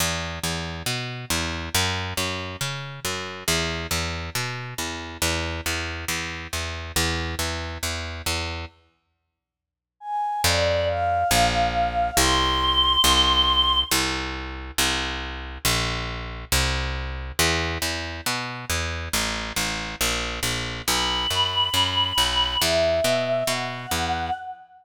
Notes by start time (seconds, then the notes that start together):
0.00 E2
0.43 E2
0.86 B2
1.30 E2
1.75 F#2
2.17 F#2
2.61 C#3
3.05 F#2
3.48 E2
3.91 E2
4.35 B2
4.78 E2
5.22 E2
5.66 E2
6.08 E2
6.53 E2
6.96 E2
7.39 E2
7.83 E2
8.26 E2
10.00 G#5
10.44 F2 D5
10.87 F5
11.31 A#1
12.17 C2 C6
13.04 C2
13.91 C2
14.78 C2
15.65 A#1
16.52 C2
17.39 E2
17.82 E2
18.26 B2
18.70 E2
19.13 A1
19.56 A1
20.01 A#1
20.43 A#1
20.87 B1 B5
21.30 F#2
21.74 F#2
22.18 B1
22.61 E2 E5
23.04 B2
23.47 B2 F#5
23.91 E2